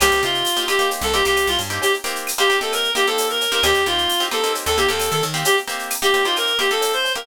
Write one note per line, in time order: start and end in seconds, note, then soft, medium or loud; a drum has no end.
0.00 0.11 C2 medium
0.00 0.19 A#3 loud
0.00 0.19 C4 loud
0.00 0.19 D#4 loud
0.00 0.22 G4 medium
0.00 0.19 G4 loud
0.00 cowbell medium
0.00 claves loud
0.00 shaker loud
0.11 0.22 C2 medium
0.11 shaker medium
0.23 0.43 C3 medium
0.23 0.50 A#3 loud
0.23 0.50 C4 medium
0.23 0.50 D#4 medium
0.23 0.64 F4 medium
0.23 0.50 G4 medium
0.23 shaker medium
0.34 shaker medium
0.45 tambourine medium
0.45 shaker loud
0.57 0.66 A#3 loud
0.57 0.66 C4 medium
0.57 0.66 D#4 medium
0.57 0.66 G4 loud
0.57 shaker medium
0.68 0.77 A#3 loud
0.68 0.77 C4 loud
0.68 0.77 D#4 loud
0.68 0.77 G4 loud
0.68 0.88 G4 medium
0.68 claves medium
0.68 shaker medium
0.79 1.06 A#3 loud
0.79 1.06 C4 loud
0.79 1.06 D#4 loud
0.79 1.06 G4 loud
0.79 shaker medium
0.91 cowbell medium
0.91 shaker medium
1.01 1.22 C2 medium
1.01 1.13 A4 medium
1.01 shaker medium
1.14 1.23 A#3 loud
1.14 1.23 C4 loud
1.14 1.23 D#4 medium
1.14 1.23 G4 medium
1.14 1.24 G4 medium
1.14 shaker medium
1.25 1.46 C2 medium
1.25 1.61 A#3 medium
1.25 1.61 C4 medium
1.25 1.61 D#4 medium
1.25 1.47 G4 medium
1.25 1.61 G4 loud
1.25 shaker medium
1.36 tambourine medium
1.36 cowbell medium
1.36 claves medium
1.36 shaker medium
1.47 1.57 C2 medium
1.47 1.59 F4 medium
1.47 shaker medium
1.59 1.79 G2 medium
1.59 cowbell medium
1.59 shaker medium
1.70 1.97 A#3 medium
1.70 1.97 C4 loud
1.70 1.97 D#4 medium
1.70 1.97 G4 loud
1.70 shaker medium
1.82 1.93 G4 medium
1.82 cowbell medium
1.82 shaker medium
1.94 shaker medium
2.04 2.31 A#3 loud
2.04 2.31 C4 loud
2.04 2.31 D#4 loud
2.04 2.31 G4 loud
2.04 shaker medium
2.15 shaker medium
2.27 tambourine medium
2.27 claves medium
2.27 shaker medium
2.38 2.47 A#3 loud
2.38 2.47 C4 loud
2.38 2.47 D#4 loud
2.38 2.47 G4 medium
2.38 2.57 G4 loud
2.38 shaker medium
2.50 2.59 A#3 medium
2.50 2.59 C4 loud
2.50 2.59 D#4 loud
2.50 2.59 G4 loud
2.50 shaker medium
2.61 2.88 A#3 loud
2.61 2.88 C4 medium
2.61 2.88 D#4 loud
2.61 2.88 G4 medium
2.61 2.72 A4 medium
2.61 shaker medium
2.72 2.91 A#4 medium
2.72 cowbell medium
2.72 claves medium
2.72 shaker medium
2.84 shaker medium
2.95 3.04 A#3 loud
2.95 3.04 C4 medium
2.95 3.04 D#4 loud
2.95 3.04 G4 loud
2.95 3.06 G4 medium
2.95 shaker medium
3.07 3.44 A#3 loud
3.07 3.44 C4 loud
3.07 3.44 D#4 medium
3.07 3.44 G4 medium
3.07 3.27 A4 medium
3.07 shaker medium
3.18 tambourine medium
3.18 cowbell medium
3.18 shaker loud
3.30 3.51 A#4 medium
3.30 shaker medium
3.41 cowbell medium
3.41 shaker medium
3.52 3.61 A#3 loud
3.52 3.61 C4 loud
3.52 3.61 D#4 medium
3.52 3.61 G4 loud
3.52 3.63 A#4 medium
3.52 shaker medium
3.63 3.73 D#2 medium
3.63 3.82 A#3 loud
3.63 3.82 C4 loud
3.63 3.82 D#4 loud
3.63 3.84 G4 loud
3.63 3.82 G4 loud
3.63 cowbell medium
3.63 claves medium
3.63 shaker medium
3.75 3.85 D#2 medium
3.75 shaker medium
3.86 4.07 D#2 medium
3.86 4.14 A#3 medium
3.86 4.14 C4 loud
3.86 4.14 D#4 loud
3.86 4.24 F4 medium
3.86 4.14 G4 loud
3.86 shaker medium
3.98 shaker medium
4.09 tambourine medium
4.09 shaker medium
4.20 4.29 A#3 medium
4.20 4.29 C4 loud
4.20 4.29 D#4 medium
4.20 4.29 G4 loud
4.20 shaker medium
4.31 4.40 A#3 loud
4.31 4.40 C4 medium
4.31 4.40 D#4 medium
4.31 4.40 G4 loud
4.31 4.52 A4 medium
4.31 claves medium
4.31 shaker medium
4.43 4.71 A#3 medium
4.43 4.71 C4 medium
4.43 4.71 D#4 loud
4.43 4.71 G4 medium
4.43 shaker medium
4.54 cowbell medium
4.54 shaker medium
4.66 4.87 D#2 medium
4.66 4.77 A4 medium
4.66 shaker medium
4.77 4.87 A#3 loud
4.77 4.87 C4 medium
4.77 4.87 D#4 medium
4.77 4.88 G4 medium
4.77 4.87 G4 medium
4.77 shaker medium
4.88 5.10 D#2 medium
4.88 5.25 A#3 loud
4.88 5.25 C4 loud
4.88 5.25 D#4 loud
4.88 5.25 G4 medium
4.88 5.10 A4 medium
4.88 shaker medium
4.99 tambourine medium
4.99 cowbell medium
4.99 claves medium
4.99 shaker loud
5.11 5.22 D#3 medium
5.11 5.22 A4 medium
5.11 shaker medium
5.22 5.44 D#3 medium
5.22 cowbell medium
5.22 shaker medium
5.34 5.61 A#3 medium
5.34 5.61 C4 medium
5.34 5.61 D#4 loud
5.34 5.61 G4 loud
5.34 shaker medium
5.45 5.56 G4 loud
5.45 cowbell medium
5.45 shaker loud
5.57 shaker medium
5.68 5.95 A#3 loud
5.68 5.95 C4 loud
5.68 5.95 D#4 loud
5.68 5.95 G4 loud
5.68 shaker medium
5.79 shaker medium
5.90 tambourine medium
5.90 claves medium
5.90 shaker medium
6.02 6.11 A#3 loud
6.02 6.11 C4 medium
6.02 6.11 D#4 medium
6.02 6.11 G4 loud
6.02 6.24 G4 medium
6.02 shaker medium
6.14 6.23 A#3 medium
6.14 6.23 C4 loud
6.14 6.23 D#4 loud
6.14 6.23 G4 loud
6.14 shaker medium
6.24 6.53 A#3 loud
6.24 6.53 C4 loud
6.24 6.53 D#4 loud
6.24 6.36 F4 medium
6.24 6.53 G4 medium
6.24 shaker medium
6.36 6.58 A#4 medium
6.36 cowbell medium
6.36 claves medium
6.36 shaker medium
6.47 shaker medium
6.59 6.68 A#3 loud
6.59 6.68 C4 loud
6.59 6.68 D#4 loud
6.59 6.68 G4 loud
6.59 6.70 G4 medium
6.59 shaker medium
6.70 7.07 A#3 medium
6.70 7.07 C4 medium
6.70 7.07 D#4 medium
6.70 7.07 G4 medium
6.70 6.92 A4 medium
6.70 shaker medium
6.81 tambourine medium
6.81 cowbell medium
6.81 shaker medium
6.93 7.13 C5 medium
6.93 shaker medium
7.04 cowbell medium
7.04 shaker medium
7.15 7.25 A#3 loud
7.15 7.25 C4 loud
7.15 7.25 D#4 medium
7.15 7.25 G4 loud
7.15 7.26 A#4 medium
7.15 shaker medium